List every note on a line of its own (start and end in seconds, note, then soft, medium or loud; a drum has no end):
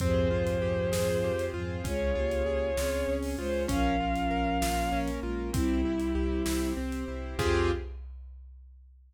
0.00 0.26 F2 loud
0.00 1.31 G#2 medium
0.00 1.31 F3 medium
0.00 0.92 C4 medium
0.00 0.29 C4 loud
0.00 0.92 F4 medium
0.00 0.92 G4 medium
0.00 0.92 G#4 medium
0.00 1.44 C5 loud
0.00 kick loud
0.00 closed hi-hat medium
0.31 0.57 F2 medium
0.31 0.58 F4 medium
0.47 closed hi-hat medium
0.61 0.88 F2 medium
0.61 0.89 G4 medium
0.92 1.18 F2 medium
0.92 1.84 C4 medium
0.92 1.84 F4 medium
0.92 1.19 G#4 medium
0.92 1.84 G#4 medium
0.92 1.84 C5 medium
0.92 snare loud
1.23 1.49 F2 medium
1.23 1.52 G4 medium
1.39 closed hi-hat medium
1.54 1.80 F2 medium
1.54 1.79 G#2 medium
1.54 1.79 F3 medium
1.54 1.81 F4 medium
1.84 2.11 C#2 medium
1.84 2.13 G#3 medium
1.84 2.12 C#4 medium
1.84 2.76 C#4 medium
1.84 2.13 F4 medium
1.84 2.76 F4 medium
1.84 2.76 G#4 medium
1.84 3.13 C#5 loud
1.84 kick loud
1.84 closed hi-hat loud
2.15 2.42 C#2 medium
2.15 2.70 A#3 medium
2.15 2.43 F4 medium
2.15 2.70 G4 medium
2.31 closed hi-hat medium
2.46 2.72 C#2 medium
2.46 2.74 G#4 medium
2.77 3.03 C#2 medium
2.77 3.35 C4 medium
2.77 3.68 C#4 medium
2.77 3.06 F4 medium
2.77 3.68 G#4 medium
2.77 3.35 G#4 medium
2.77 3.68 C#5 medium
2.77 snare loud
3.08 3.34 C#2 medium
3.08 3.36 C#4 medium
3.23 open hi-hat medium
3.38 3.64 C#2 medium
3.38 3.67 G#3 medium
3.38 3.66 F4 medium
3.38 3.67 F4 medium
3.38 3.63 C5 loud
3.68 3.95 A#1 medium
3.68 5.10 F3 medium
3.68 3.96 C#4 loud
3.68 4.61 C#4 medium
3.68 5.10 C#4 medium
3.68 4.61 F4 medium
3.68 4.61 A#4 medium
3.68 4.99 F5 loud
3.68 kick loud
3.68 closed hi-hat loud
4.00 4.26 A#1 medium
4.00 4.28 F4 medium
4.16 closed hi-hat medium
4.31 4.57 A#1 medium
4.31 4.58 A#4 medium
4.62 4.88 A#1 medium
4.62 5.53 A#3 medium
4.62 5.53 C#4 medium
4.62 4.89 F4 medium
4.62 5.53 A#4 medium
4.62 snare loud
4.92 5.18 A#1 medium
4.92 5.20 C#4 loud
5.08 closed hi-hat medium
5.23 5.49 A#1 medium
5.23 5.50 G#3 medium
5.23 5.50 F4 medium
5.23 5.51 F4 medium
5.53 5.80 C2 medium
5.53 6.73 G3 medium
5.53 5.81 C4 medium
5.53 6.46 C4 medium
5.53 6.70 E4 medium
5.53 6.73 E4 medium
5.53 6.46 E4 medium
5.53 6.46 G4 medium
5.53 kick loud
5.53 closed hi-hat loud
5.85 6.11 C2 medium
5.85 6.13 E4 medium
6.00 closed hi-hat medium
6.15 6.41 C2 medium
6.15 6.43 G4 medium
6.46 6.72 C2 medium
6.46 7.38 C4 medium
6.46 6.73 E4 medium
6.46 7.38 G4 medium
6.46 7.38 C5 medium
6.46 snare loud
6.77 7.03 C2 medium
6.77 7.04 C4 medium
6.92 closed hi-hat medium
7.08 7.34 C2 medium
7.08 7.36 E4 medium
7.38 7.71 F2 loud
7.38 7.71 C4 loud
7.38 7.71 F4 loud
7.38 7.71 G4 loud
7.38 7.71 G#4 loud
7.38 kick loud
7.38 crash loud